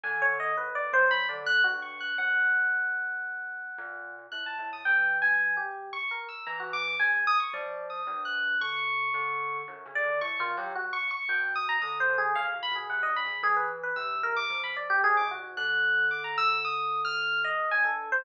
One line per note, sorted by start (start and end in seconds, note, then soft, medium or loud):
0.03 0.52 D3 loud
0.03 0.20 G#5 medium
0.22 0.38 C#5 loud
0.40 0.56 D#5 medium
0.57 0.89 F#2 medium
0.57 0.73 B4 medium
0.75 0.91 D5 medium
0.93 1.25 F#3 medium
0.93 1.10 C5 loud
1.11 1.27 B5 loud
1.29 1.61 D3 medium
1.29 1.45 D5 soft
1.46 1.62 F#6 loud
1.64 2.13 G2 medium
1.64 1.80 F#4 medium
1.82 1.98 C#6 medium
2.00 2.17 F#6 medium
2.18 3.63 F#2 medium
2.18 4.11 F#5 medium
3.78 4.27 A#2 loud
4.32 4.56 A2 medium
4.32 4.44 F#6 medium
4.46 4.70 A5 medium
4.59 4.83 A2 medium
4.73 4.85 D#6 medium
4.85 5.58 E3 medium
4.85 5.17 G5 medium
5.22 5.54 G#5 medium
5.57 5.89 G4 medium
5.93 6.09 C#6 medium
6.11 6.27 A#4 soft
6.29 6.45 E6 medium
6.47 6.95 E3 loud
6.47 6.59 A#5 medium
6.60 6.72 F#4 medium
6.73 6.97 D6 loud
7.00 7.24 C#3 medium
7.00 7.24 G#5 medium
7.27 7.39 D#6 loud
7.40 7.52 C#6 medium
7.53 8.02 F3 medium
7.53 7.86 D5 medium
7.90 8.22 D#6 medium
8.07 8.55 G2 loud
8.25 8.57 F#6 medium
8.61 9.09 D3 medium
8.61 9.58 C#6 loud
9.14 9.62 D3 loud
9.68 9.84 F#2 loud
9.86 10.02 C#3 medium
9.95 10.19 D5 loud
10.04 10.20 D3 medium
10.21 10.38 A2 medium
10.21 10.37 C#6 medium
10.39 10.55 D#3 loud
10.39 10.56 F4 loud
10.57 10.73 F#3 loud
10.57 10.74 G4 medium
10.75 10.92 F#4 medium
10.93 11.09 C#6 loud
11.11 11.27 C#6 loud
11.29 11.77 B2 loud
11.29 11.53 G5 medium
11.55 11.68 D#6 medium
11.69 11.81 A#5 loud
11.82 12.06 D3 medium
11.82 11.98 D#6 medium
12.00 12.16 C5 medium
12.09 12.33 D3 medium
12.18 12.34 G#4 medium
12.35 12.52 C#3 loud
12.35 12.48 F5 loud
12.53 12.70 A#2 medium
12.63 12.75 B5 loud
12.72 12.88 B2 medium
12.72 12.87 G#4 soft
12.89 13.05 C3 medium
12.89 13.02 F#5 medium
13.03 13.15 D#5 medium
13.07 13.23 G2 medium
13.16 13.41 B5 medium
13.25 13.41 C#3 medium
13.43 13.91 E3 medium
13.43 13.55 G#4 loud
13.56 13.69 B4 medium
13.83 13.95 B4 medium
13.96 14.45 C3 medium
13.96 14.20 E6 medium
14.23 14.35 A#4 loud
14.36 14.61 D6 loud
14.50 14.98 F3 medium
14.64 14.76 B5 medium
14.77 14.89 D5 medium
14.90 15.02 G4 loud
15.04 15.20 G#2 loud
15.04 15.16 G#4 loud
15.17 15.29 D6 medium
15.21 15.37 C3 medium
15.31 15.55 F#4 medium
15.39 15.55 G#2 medium
15.57 17.50 D3 loud
15.57 16.05 F#6 medium
16.11 16.23 D6 medium
16.24 16.36 A#5 medium
16.38 16.62 E6 loud
16.65 17.01 D#6 medium
17.05 17.41 F6 loud
17.44 17.69 D#5 medium
17.71 18.20 G2 medium
17.71 17.83 G#5 loud
17.85 18.09 A4 medium
18.12 18.24 C5 loud